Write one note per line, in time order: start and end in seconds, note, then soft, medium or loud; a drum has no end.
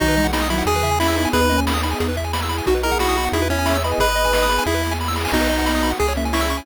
0.00 0.63 B1 loud
0.00 0.16 D#3 medium
0.00 0.16 F#3 medium
0.00 0.65 B3 medium
0.00 0.27 D#4 loud
0.00 0.65 D#4 medium
0.00 0.65 F#4 medium
0.00 0.08 F#4 loud
0.00 kick loud
0.00 crash medium
0.08 0.16 B4 medium
0.08 closed hi-hat medium
0.16 0.43 E3 medium
0.16 0.43 G#3 medium
0.16 0.25 D#5 medium
0.16 closed hi-hat medium
0.24 0.32 F#5 medium
0.24 kick medium
0.24 closed hi-hat medium
0.33 0.48 D#4 medium
0.33 0.41 B5 medium
0.33 snare loud
0.41 0.50 D#6 medium
0.41 closed hi-hat medium
0.50 0.80 D#3 medium
0.50 0.80 F#3 medium
0.50 0.64 E4 medium
0.50 0.57 B5 medium
0.50 closed hi-hat medium
0.58 0.66 F#5 medium
0.58 closed hi-hat medium
0.66 1.27 E2 loud
0.66 1.33 B3 medium
0.66 1.33 E4 medium
0.66 0.99 G#4 loud
0.66 1.33 G#4 medium
0.66 0.75 G#4 loud
0.66 kick medium
0.66 closed hi-hat medium
0.75 0.83 B4 medium
0.75 closed hi-hat medium
0.83 0.96 C#3 medium
0.83 0.96 E3 medium
0.83 0.91 E5 medium
0.83 kick medium
0.83 closed hi-hat medium
0.91 0.99 G#5 loud
0.91 closed hi-hat medium
1.00 1.15 C#4 medium
1.00 1.29 E4 medium
1.00 1.15 E4 medium
1.00 1.07 B5 loud
1.00 snare loud
1.08 1.15 E6 medium
1.08 closed hi-hat medium
1.16 1.30 B3 medium
1.16 1.30 D#4 medium
1.16 1.24 B5 medium
1.16 closed hi-hat medium
1.25 1.32 G#5 medium
1.25 closed hi-hat medium
1.33 1.95 D#2 loud
1.33 1.49 B3 medium
1.33 2.00 B3 medium
1.33 1.49 D#4 medium
1.33 2.00 D#4 medium
1.33 1.41 G#4 loud
1.33 2.00 G#4 medium
1.33 1.60 B4 loud
1.33 kick loud
1.33 closed hi-hat loud
1.41 1.48 B4 medium
1.41 closed hi-hat medium
1.49 1.79 A#3 medium
1.49 1.79 C#4 medium
1.49 1.57 D#5 medium
1.49 closed hi-hat medium
1.58 1.65 G#5 medium
1.58 kick medium
1.58 closed hi-hat medium
1.67 1.74 B5 loud
1.67 snare loud
1.74 1.82 D#6 medium
1.74 closed hi-hat medium
1.83 2.10 B3 medium
1.83 2.10 D#4 medium
1.83 1.91 B5 medium
1.83 closed hi-hat medium
1.91 1.99 G#5 medium
1.91 closed hi-hat medium
2.00 2.62 E2 loud
2.00 2.66 B3 medium
2.00 2.66 E4 medium
2.00 2.66 G#4 medium
2.00 2.08 G#4 loud
2.00 kick medium
2.00 closed hi-hat medium
2.08 2.16 B4 medium
2.08 closed hi-hat medium
2.16 2.25 E5 medium
2.16 kick medium
2.16 closed hi-hat medium
2.24 2.32 G#5 medium
2.24 closed hi-hat medium
2.33 2.41 B5 loud
2.33 snare loud
2.41 2.50 E6 medium
2.41 closed hi-hat medium
2.49 2.57 B5 medium
2.49 closed hi-hat medium
2.58 2.66 G#5 medium
2.58 closed hi-hat medium
2.66 3.29 B1 medium
2.66 3.33 B3 medium
2.66 2.82 D#4 medium
2.66 3.33 D#4 medium
2.66 2.82 F#4 medium
2.66 2.74 F#4 loud
2.66 3.33 F#4 medium
2.66 kick loud
2.66 closed hi-hat medium
2.75 2.82 B4 medium
2.75 closed hi-hat medium
2.83 3.16 E4 medium
2.83 3.16 G#4 medium
2.83 2.98 A#4 medium
2.83 2.91 D#5 medium
2.83 closed hi-hat medium
2.91 2.99 F#5 medium
2.91 kick medium
2.91 closed hi-hat medium
2.99 3.29 F#4 medium
2.99 3.08 B5 medium
2.99 snare loud
3.08 3.16 D#6 medium
3.08 closed hi-hat medium
3.16 3.44 D#4 medium
3.16 3.44 F#4 medium
3.16 3.25 B5 medium
3.16 closed hi-hat medium
3.25 3.32 F#5 medium
3.25 closed hi-hat medium
3.32 3.94 E2 loud
3.32 3.99 B3 medium
3.32 3.48 E4 medium
3.32 3.99 E4 medium
3.32 3.99 G#4 medium
3.32 3.41 G#4 loud
3.32 kick medium
3.32 closed hi-hat loud
3.41 3.50 B4 medium
3.41 closed hi-hat medium
3.49 3.77 C#4 medium
3.49 3.67 C#4 medium
3.49 3.67 E4 medium
3.49 3.58 E5 medium
3.49 kick medium
3.49 closed hi-hat medium
3.58 3.66 G#5 medium
3.58 closed hi-hat medium
3.66 3.82 C#5 medium
3.66 3.82 E5 medium
3.66 3.73 B5 loud
3.66 snare loud
3.75 3.83 E6 medium
3.75 closed hi-hat medium
3.83 3.99 B4 medium
3.83 3.99 D#5 medium
3.83 3.92 B5 medium
3.83 closed hi-hat medium
3.91 3.99 G#5 medium
3.91 closed hi-hat medium
3.98 4.59 G#1 loud
3.98 4.66 B3 medium
3.98 4.66 D#4 medium
3.98 4.07 G#4 loud
3.98 4.66 G#4 medium
3.98 4.46 B4 medium
3.98 4.64 B4 loud
3.98 4.46 D#5 medium
3.98 kick loud
3.98 closed hi-hat medium
4.08 4.16 B4 medium
4.08 closed hi-hat medium
4.16 4.23 D#5 medium
4.16 closed hi-hat medium
4.24 4.32 G#5 medium
4.24 kick medium
4.24 closed hi-hat medium
4.33 4.41 B5 medium
4.33 snare loud
4.41 4.50 D#6 medium
4.41 closed hi-hat medium
4.49 4.57 B5 medium
4.49 closed hi-hat medium
4.59 4.66 G#5 loud
4.59 closed hi-hat medium
4.66 5.27 E2 loud
4.66 5.32 B3 medium
4.66 5.32 E4 medium
4.66 4.93 E4 medium
4.66 5.32 G#4 medium
4.66 4.75 G#4 loud
4.66 kick medium
4.66 snare medium
4.74 4.82 B4 medium
4.74 snare medium
4.83 4.91 E5 medium
4.83 snare medium
4.91 4.99 G#5 medium
4.91 snare medium
5.00 5.08 B5 medium
5.00 snare medium
5.05 5.16 E6 medium
5.05 snare medium
5.08 snare medium
5.13 5.23 B5 medium
5.13 snare medium
5.16 snare medium
5.21 5.32 G#5 medium
5.21 snare medium
5.25 snare medium
5.28 5.93 B1 loud
5.28 snare loud
5.32 5.98 B3 medium
5.32 5.90 B3 medium
5.32 5.98 D#4 medium
5.32 5.90 D#4 medium
5.32 5.92 D#4 medium
5.32 5.98 F#4 medium
5.32 5.41 F#4 loud
5.32 kick medium
5.32 crash medium
5.41 5.48 B4 medium
5.41 closed hi-hat medium
5.49 5.57 D#5 medium
5.49 closed hi-hat medium
5.58 5.66 F#5 medium
5.58 kick medium
5.58 closed hi-hat medium
5.66 5.74 B5 medium
5.66 snare medium
5.74 5.82 D#6 medium
5.74 closed hi-hat medium
5.83 5.90 B5 medium
5.83 closed hi-hat medium
5.91 5.98 F#5 medium
5.91 closed hi-hat medium
6.00 6.61 C#2 loud
6.00 6.66 C#4 medium
6.00 6.66 E4 medium
6.00 6.13 G#4 medium
6.00 6.07 G#4 loud
6.00 6.66 G#4 medium
6.00 kick medium
6.00 closed hi-hat medium
6.08 6.16 C#5 medium
6.08 closed hi-hat medium
6.16 6.31 A#3 medium
6.16 6.31 C#4 medium
6.16 6.25 E5 medium
6.16 kick medium
6.16 closed hi-hat medium
6.25 6.33 G#5 medium
6.25 closed hi-hat medium
6.33 6.65 C#4 medium
6.33 6.63 E4 medium
6.33 6.65 E4 medium
6.33 6.41 C#6 loud
6.33 snare loud
6.41 6.48 E6 medium
6.41 closed hi-hat medium
6.49 6.57 C#6 loud
6.49 closed hi-hat medium
6.57 6.65 G#5 medium
6.57 closed hi-hat medium